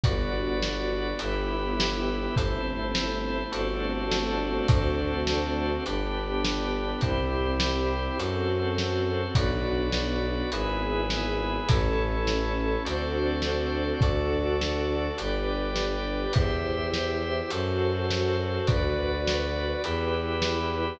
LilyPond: <<
  \new Staff \with { instrumentName = "String Ensemble 1" } { \time 4/4 \key g \major \tempo 4 = 103 <b d' fis'>2 <b e' g'>2 | <a c' e'>2 <a c' d' fis'>2 | <a c' d' fis'>2 <b d' g'>2 | <c' e' g'>2 <c' fis' a'>2 |
<b d' fis'>2 <b e' gis'>2 | <cis' e' a'>2 <c' d' fis' a'>2 | <d' fis' a'>2 <d' g' b'>2 | <e' g' c''>2 <fis' a' c''>2 |
<fis' b' d''>2 <e' g' b'>2 | }
  \new Staff \with { instrumentName = "Drawbar Organ" } { \time 4/4 \key g \major <fis' b' d''>2 <e' g' b'>2 | <e' a' c''>2 <d' fis' a' c''>2 | <d' fis' a' c''>2 <d' g' b'>2 | <e' g' c''>2 <fis' a' c''>2 |
<fis' b' d''>2 <e' gis' b'>2 | <e' a' cis''>2 <fis' a' c'' d''>2 | <fis' a' d''>2 <g' b' d''>2 | <g' c'' e''>2 <fis' a' c''>2 |
<fis' b' d''>2 <e' g' b'>2 | }
  \new Staff \with { instrumentName = "Violin" } { \clef bass \time 4/4 \key g \major g,,2 g,,2 | g,,2 g,,2 | d,2 g,,2 | c,2 fis,2 |
b,,2 gis,,2 | a,,2 d,2 | d,2 g,,2 | e,2 fis,2 |
d,2 e,2 | }
  \new DrumStaff \with { instrumentName = "Drums" } \drummode { \time 4/4 <hh bd>4 sn4 hh4 sn4 | <hh bd>4 sn4 hh4 sn4 | <hh bd>4 sn4 hh4 sn4 | <hh bd>4 sn4 hh4 sn4 |
<hh bd>4 sn4 hh4 sn4 | <hh bd>4 sn4 hh4 sn4 | <hh bd>4 sn4 hh4 sn4 | <hh bd>4 sn4 hh4 sn4 |
<hh bd>4 sn4 hh4 sn4 | }
>>